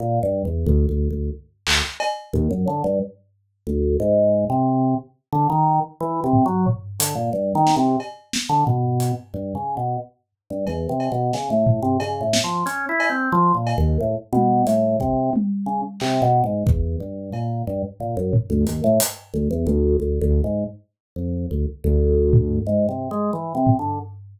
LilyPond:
<<
  \new Staff \with { instrumentName = "Drawbar Organ" } { \time 6/4 \tempo 4 = 90 \tuplet 3/2 { bes,8 g,8 e,8 d,8 d,8 d,8 } r8 d,16 r8. ees,16 ges,16 d16 g,16 r4 d,8 | aes,8. c8. r8 d16 ees8 r16 \tuplet 3/2 { e8 c8 ges8 } r8 d16 bes,16 \tuplet 3/2 { g,8 ees8 c8 } | r8. d16 b,8. r16 \tuplet 3/2 { g,8 des8 b,8 } r8. g,16 \tuplet 3/2 { e,8 c8 b,8 } des16 a,8 c16 | \tuplet 3/2 { des8 a,8 f8 des'8 e'8 c'8 f8 bes,8 ees,8 } a,16 r16 b,8 a,8 c8 r8 des16 r16 |
\tuplet 3/2 { c8 b,8 aes,8 } e,8 g,8 bes,8 g,16 r16 bes,16 ges,16 r16 d,16 ees,16 a,16 r8 d,16 e,16 d,8 | \tuplet 3/2 { d,8 d,8 aes,8 } r8. f,8 d,16 r16 d,4~ d,16 \tuplet 3/2 { aes,8 c8 aes8 e8 c8 d8 } | }
  \new DrumStaff \with { instrumentName = "Drums" } \drummode { \time 6/4 r4 tomfh4 r8 hc8 cb8 tomfh8 r4 r4 | r4 r4 r4 r8 tomfh8 tomfh8 hh8 r8 sn8 | cb8 sn8 tomfh8 hh8 r4 r4 cb8 cb8 sn8 tomfh8 | cb8 sn8 hh8 cb8 r8 cb8 r8 tommh8 hh8 bd8 tommh4 |
hc4 bd4 cb4 tomfh8 tomfh8 hh8 hh8 r4 | r4 r4 r4 r8 tomfh8 r4 r8 tomfh8 | }
>>